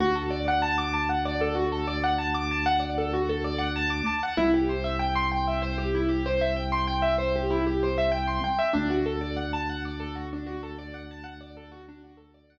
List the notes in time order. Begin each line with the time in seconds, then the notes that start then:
0.00 D2 F#4
0.15 A4
0.30 D5
0.48 F#5
0.62 A5
0.78 D6
0.93 A5
1.09 F#5
1.25 D5
1.41 A4
1.55 F#4
1.72 A4
1.88 D5
2.04 F#5
2.18 A5
2.34 D6
2.51 A5
2.66 F#5
2.80 D5
2.98 A4
3.13 F#4
3.29 A4
3.44 D5
3.58 F#5
3.76 A5
3.90 D6
4.06 A5
4.23 F#5
4.37 C2 E4
4.54 G4
4.69 C5
4.84 E5
4.99 G5
5.15 C6
5.32 G5
5.48 E5
5.62 C5
5.78 G4
5.95 E4
6.09 G4
6.26 C5
6.41 E5
6.56 G5
6.72 C6
6.87 G5
7.02 E5
7.18 C5
7.36 G4
7.50 E4
7.67 G4
7.83 C5
7.98 E5
8.12 G5
8.27 C6
8.44 G5
8.59 E5
8.73 D2 D4
8.90 F#4
9.06 A4
9.21 D5
9.36 F#5
9.53 A5
9.69 F#5
9.85 D5
10.00 A4
10.15 F#4
10.33 D4
10.46 F#4
10.63 A4
10.78 D5
10.94 F#5
11.11 A5
11.24 F#5
11.41 D5
11.57 A4
11.72 F#4
11.88 D4
12.04 F#4
12.17 A4
12.34 D5
12.50 F#5